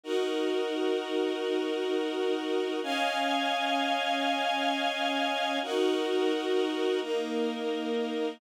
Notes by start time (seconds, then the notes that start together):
0.03 D#4 F#4 A#4
2.82 C#4 D#5 F5 G#5
5.62 D#4 F#4 A#4
7.01 A#3 D#4 A#4